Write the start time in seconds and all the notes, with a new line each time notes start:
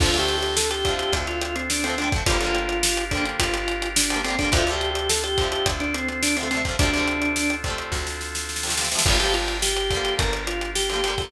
0.00 D2 D3 F3 A3 C4 D4 F4 A4, kick, crash
0.06 C4
0.14 D3 F3 A3, closed hi-hat
0.19 C4 G4
0.28 closed hi-hat
0.38 G4
0.43 closed hi-hat
0.56 A4, snare
0.70 G4, closed hi-hat
0.85 D3 F3 A3, kick, closed hi-hat
0.91 C4
0.99 G4, closed hi-hat
1.13 D2, kick, closed hi-hat
1.27 F4, closed hi-hat
1.42 F4, closed hi-hat
1.56 C4, closed hi-hat
1.70 D4, snare
1.84 D3 F3 A3 C4, closed hi-hat
1.90 C4
1.98 D3 F3 A3 D4, closed hi-hat
2.04 C4
2.12 D3 F3 A3, kick, closed hi-hat
2.18 C4
2.26 G1 D3 F3 G3 D4 F4 G4 A#4, kick, closed hi-hat
2.32 A#3
2.41 D3 F3 G3, closed hi-hat
2.46 A#3
2.55 closed hi-hat
2.69 closed hi-hat
2.83 snare
2.97 closed hi-hat
3.11 D3 F3 G3 D4, kick, closed hi-hat
3.17 A#3
3.25 closed hi-hat
3.40 G1 F4, kick, closed hi-hat
3.54 closed hi-hat
3.68 closed hi-hat
3.82 closed hi-hat
3.96 D4, snare
4.10 D3 F3 G3, closed hi-hat
4.16 A#3
4.24 D3 F3 G3 C4, closed hi-hat
4.30 A#3
4.39 D3 F3 G3 D4, kick, closed hi-hat
4.44 A#3
4.52 D2 C3 D3 C4 D4 F4 A4, kick, closed hi-hat
4.57 F3 A3
4.67 C3 D3, closed hi-hat
4.71 F3 A3 G4
4.81 closed hi-hat
4.91 G4
4.95 closed hi-hat
5.09 A4, snare
5.24 G4, closed hi-hat
5.38 C3 D3 F3, kick, closed hi-hat
5.44 A3
5.52 G4, closed hi-hat
5.66 D2, kick, closed hi-hat
5.80 D4, closed hi-hat
5.94 C4, closed hi-hat
6.08 C4, closed hi-hat
6.23 D4, snare
6.37 C3 D3 C4, closed hi-hat
6.41 F3 A3
6.51 C3 D3 F3 C4, closed hi-hat
6.57 A3
6.65 C3 D3 F3, kick, closed hi-hat
6.71 A3
6.79 D2 C3 D3 C4 D4 F4 A4, kick, closed hi-hat
6.83 F3 A3
6.94 C3 D3 F3, closed hi-hat
6.99 A3
7.08 closed hi-hat
7.22 closed hi-hat
7.36 snare
7.50 closed hi-hat
7.64 C3 D3, kick, closed hi-hat
7.68 F3 A3
7.78 closed hi-hat
7.92 D2, kick, snare
8.07 snare
8.21 snare
8.35 snare
8.49 snare
8.56 snare
8.63 C3 D3 F3, snare
8.69 A3, snare
8.77 C3 D3 F3, snare
8.83 A3, snare
8.91 C3 D3 F3, snare
8.97 A3, snare
9.06 G1 D3 F3 D4 F4 G4 A#4, kick, crash
9.10 G3 A#3
9.20 D3 F3 G3 G4, closed hi-hat
9.26 A#3
9.34 F4, closed hi-hat
9.48 closed hi-hat
9.62 G4, snare
9.77 closed hi-hat
9.90 D3 F3, kick, closed hi-hat
9.95 G3 A#3
10.05 closed hi-hat
10.19 G1 A#4, kick, closed hi-hat
10.33 closed hi-hat
10.47 F4, closed hi-hat
10.61 closed hi-hat
10.75 G4, snare
10.90 D3 F3 G4, closed hi-hat
10.94 G3 A#3
11.04 D3 F3 G3, closed hi-hat
11.10 A#3
11.18 D3 F3 G3, kick, closed hi-hat
11.24 A#3